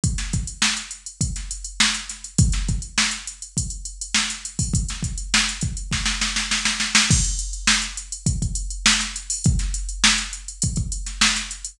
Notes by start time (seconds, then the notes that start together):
0.04 kick, closed hi-hat
0.18 snare, closed hi-hat
0.33 kick, closed hi-hat
0.47 closed hi-hat
0.62 snare
0.77 closed hi-hat
0.91 closed hi-hat
1.06 closed hi-hat
1.21 kick, closed hi-hat
1.36 snare, closed hi-hat
1.51 closed hi-hat
1.65 closed hi-hat
1.80 snare
1.95 closed hi-hat
2.09 snare, closed hi-hat
2.24 closed hi-hat
2.38 kick, closed hi-hat
2.52 snare, closed hi-hat
2.69 kick, closed hi-hat
2.82 closed hi-hat
2.98 snare
3.11 closed hi-hat
3.27 closed hi-hat
3.42 closed hi-hat
3.57 kick, closed hi-hat
3.70 closed hi-hat
3.85 closed hi-hat
4.01 closed hi-hat
4.14 snare
4.30 snare, closed hi-hat
4.45 closed hi-hat
4.59 kick, open hi-hat
4.74 kick, closed hi-hat
4.89 snare, closed hi-hat
5.03 kick, closed hi-hat
5.18 closed hi-hat
5.34 snare
5.49 closed hi-hat
5.61 kick, closed hi-hat
5.77 closed hi-hat
5.92 kick, snare
6.06 snare
6.21 snare
6.36 snare
6.51 snare
6.65 snare
6.80 snare
6.95 snare
7.11 kick, crash
7.24 closed hi-hat
7.39 closed hi-hat
7.53 closed hi-hat
7.67 snare
7.82 closed hi-hat
7.97 closed hi-hat
8.12 closed hi-hat
8.26 kick, closed hi-hat
8.42 kick, closed hi-hat
8.55 closed hi-hat
8.70 closed hi-hat
8.86 snare
9.00 snare, closed hi-hat
9.16 closed hi-hat
9.30 open hi-hat
9.44 kick, closed hi-hat
9.59 snare, closed hi-hat
9.74 closed hi-hat
9.89 closed hi-hat
10.04 snare
10.18 closed hi-hat
10.33 closed hi-hat
10.48 closed hi-hat
10.62 kick, closed hi-hat
10.76 kick, closed hi-hat
10.92 closed hi-hat
11.06 snare, closed hi-hat
11.21 snare
11.36 snare, closed hi-hat
11.51 closed hi-hat
11.65 closed hi-hat